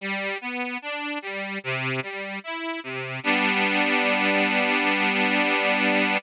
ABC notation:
X:1
M:4/4
L:1/8
Q:1/4=74
K:G
V:1 name="Accordion"
G, B, D G, C, G, E C, | [G,B,D]8 |]